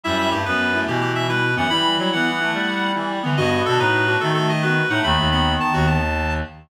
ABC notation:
X:1
M:12/8
L:1/16
Q:3/8=144
K:Em
V:1 name="Clarinet"
e2 e2 G2 B6 G2 G2 e2 B4 f2 | b4 b2 f14 z4 | ^d2 d2 A2 B6 A2 A2 d2 B4 f2 | b4 b4 a2 F2 a8 z4 |]
V:2 name="Clarinet"
E5 z5 E8 E4 B,2 | E10 E8 E4 B,2 | F10 F8 F4 ^D2 | A,2 A,2 B,10 z10 |]
V:3 name="Clarinet"
G,4 A,2 B,4 A,2 E,6 G,2 z2 E,2 | G,2 G,2 G,2 B,4 A,4 G,4 E,2 G,2 D,2 | B,4 D2 ^D4 =D2 A,6 B,2 z2 A,2 | ^D,16 z8 |]
V:4 name="Clarinet" clef=bass
F,,4 G,,2 F,,6 B,,10 F,,2 | E,4 F,2 E,6 G,10 E,2 | G,,4 B,,2 A,,6 ^D,10 A,,2 | ^D,,2 D,,6 z2 D,,10 z4 |]